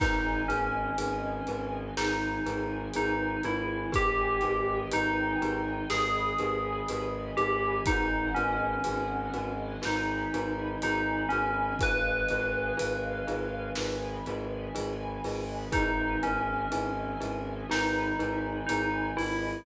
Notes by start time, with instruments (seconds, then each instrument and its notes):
0.00 violin G#1, tubular bells D#4, glockenspiel D#4 G#4 B4, string ensemble 1 B4 D#5 G#5, kick, crash
0.48 violin G#1, tubular bells C#4, glockenspiel D#4 G#4 B4, closed hi-hat
0.98 violin G#1, glockenspiel D#4 G#4 B4, closed hi-hat
1.47 violin G#1, glockenspiel D#4 G#4 B4, closed hi-hat
1.97 violin G#1, glockenspiel D#4 G#4 B4, tubular bells D#4, string ensemble 1 G#4 B4 G#5, snare
2.46 violin G#1, glockenspiel D#4 G#4 B4, closed hi-hat
2.94 violin G#1, glockenspiel D#4 G#4 B4, tubular bells D#4, closed hi-hat
3.43 violin G#1, glockenspiel D#4 G#4 B4, tubular bells E4, closed hi-hat
3.92 violin G#1, glockenspiel D#4 G4 G#4 B4, tubular bells G4, string ensemble 1 B4 D#5 G5 G#5, kick, closed hi-hat
4.41 violin G#1, glockenspiel D#4 G4 G#4 B4, closed hi-hat
4.92 violin G#1, glockenspiel D#4 G4 G#4 B4, tubular bells D#4, closed hi-hat
5.41 violin G#1, glockenspiel D#4 G4 G#4 B4, closed hi-hat
5.90 violin G#1, glockenspiel D#4 G4 G#4 B4, tubular bells G#4, string ensemble 1 B4 D#5 G#5 B5, snare
6.39 violin G#1, glockenspiel D#4 G4 G#4 B4, closed hi-hat
6.89 violin G#1, glockenspiel D#4 G4 G#4 B4, closed hi-hat
7.37 violin G#1, glockenspiel D#4 G4 G#4 B4, tubular bells G4, closed hi-hat
7.86 violin G#1, tubular bells D#4, glockenspiel D#4 F#4 G#4 B4, string ensemble 1 B4 D#5 F#5 G#5, kick, closed hi-hat
8.35 violin G#1, tubular bells C#4, glockenspiel D#4 F#4 G#4 B4, closed hi-hat
8.84 violin G#1, glockenspiel D#4 F#4 G#4 B4, closed hi-hat
9.34 violin G#1, glockenspiel D#4 F#4 G#4 B4, closed hi-hat
9.82 violin G#1, glockenspiel D#4 F#4 G#4 B4, tubular bells D#4, string ensemble 1 B4 D#5 G#5 B5, snare
10.33 violin G#1, glockenspiel D#4 F#4 G#4 B4, closed hi-hat
10.82 violin G#1, glockenspiel D#4 F#4 G#4 B4, tubular bells D#4, closed hi-hat
11.29 violin G#1, tubular bells C#4, glockenspiel D#4 F#4 G#4 B4, closed hi-hat
11.79 violin G#1, glockenspiel D#4 F4 G#4 B4, string ensemble 1 B4 D#5 F5 G#5, tubular bells B4, kick, closed hi-hat
12.28 violin G#1, glockenspiel D#4 F4 G#4 B4, closed hi-hat
12.77 violin G#1, glockenspiel D#4 F4 G#4 B4, closed hi-hat
13.27 violin G#1, glockenspiel D#4 F4 G#4 B4, closed hi-hat
13.75 violin G#1, glockenspiel D#4 F4 G#4 B4, string ensemble 1 B4 D#5 G#5 B5, snare
14.26 violin G#1, glockenspiel D#4 F4 G#4 B4, closed hi-hat
14.75 violin G#1, glockenspiel D#4 F4 G#4 B4, closed hi-hat
15.24 violin G#1, glockenspiel D#4 F4 G#4 B4, open hi-hat
15.72 violin G#1, glockenspiel D#4 E4 G#4 B4, tubular bells D#4, string ensemble 1 B4 D#5 E5 G#5, kick, closed hi-hat
16.23 violin G#1, tubular bells C#4, glockenspiel D#4 E4 G#4 B4, closed hi-hat
16.72 violin G#1, glockenspiel D#4 E4 G#4 B4, closed hi-hat
17.20 violin G#1, glockenspiel D#4 E4 G#4 B4, closed hi-hat
17.69 violin G#1, glockenspiel D#4 E4 G#4 B4, tubular bells D#4, string ensemble 1 B4 D#5 G#5 B5, snare
18.19 violin G#1, glockenspiel D#4 E4 G#4 B4, closed hi-hat
18.67 violin G#1, tubular bells D#4, glockenspiel D#4 E4 G#4 B4, closed hi-hat
19.17 violin G#1, glockenspiel D#4 E4 G#4 B4, tubular bells E4, open hi-hat